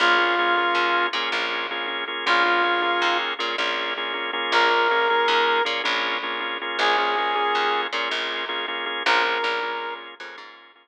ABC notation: X:1
M:12/8
L:1/8
Q:3/8=106
K:Bbm
V:1 name="Brass Section"
F6 z6 | F6 z6 | B6 z6 | A6 z6 |
B5 z7 |]
V:2 name="Drawbar Organ"
[B,DFA] [B,DFA] [B,DFA] [B,DFA]3 [B,DFA] [B,DFA]2 [B,DFA] [B,DFA] [B,DFA] | [B,DFA] [B,DFA] [B,DFA] [B,DFA]3 [B,DFA] [B,DFA]2 [B,DFA] [B,DFA] [B,DFA]- | [B,DFA] [B,DFA] [B,DFA] [B,DFA]3 [B,DFA] [B,DFA]2 [B,DFA] [B,DFA] [B,DFA] | [B,DFA] [B,DFA] [B,DFA] [B,DFA]3 [B,DFA] [B,DFA]2 [B,DFA] [B,DFA] [B,DFA] |
[B,DFA] [B,DFA] [B,DFA] [B,DFA]3 [B,DFA] [B,DFA]2 [B,DFA] z2 |]
V:3 name="Electric Bass (finger)" clef=bass
B,,,4 E,,2 B,, B,,,5 | B,,,4 E,,2 B,, B,,,5 | B,,,4 E,,2 B,, B,,,5 | B,,,4 E,,2 B,, B,,,5 |
B,,,2 B,,,4 F,, A,,5 |]